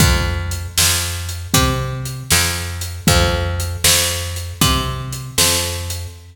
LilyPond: <<
  \new Staff \with { instrumentName = "Electric Bass (finger)" } { \clef bass \time 4/4 \key f \major \tempo 4 = 78 f,4 f,4 c4 f,4 | f,4 f,4 c4 f,4 | }
  \new DrumStaff \with { instrumentName = "Drums" } \drummode { \time 4/4 \tuplet 3/2 { <hh bd>8 r8 hh8 sn8 r8 hh8 <hh bd>8 r8 hh8 sn8 r8 hh8 } | \tuplet 3/2 { <hh bd>8 r8 hh8 sn8 r8 hh8 <hh bd>8 r8 hh8 sn8 r8 hh8 } | }
>>